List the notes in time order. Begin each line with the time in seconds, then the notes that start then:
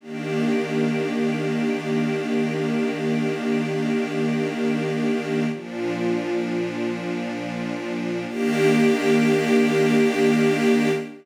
0.01 D#3 A#3 D4 G4
5.52 A#2 F3 D4
8.27 D#3 A#3 D4 G4